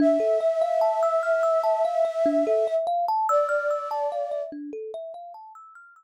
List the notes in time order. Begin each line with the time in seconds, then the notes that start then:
0.00 D4 E5
0.20 A4
0.41 E5
0.61 F5
0.81 A5
1.03 E6
1.23 F6
1.43 E6
1.64 A5
1.85 F5
2.05 E5
2.26 D4
2.47 A4
2.67 E5
2.87 F5
3.08 A5
3.29 D5 E6
3.49 F6
3.71 E6
3.91 A5
4.12 F5
4.32 E5
4.52 D4
4.73 A4
4.94 E5
5.14 F5
5.34 A5
5.55 E6
5.75 F6
5.96 E6